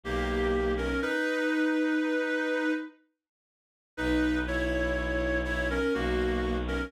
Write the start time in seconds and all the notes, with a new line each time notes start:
0.03 B1 A#3 G4
0.77 C#4 A#4
1.02 D#4 B4
3.97 B1 D#4 B4
4.47 E4 C#5
5.44 E4 C#5
5.70 C#4 A#4
5.94 B1 A#3 F#4
6.68 C#4 A#4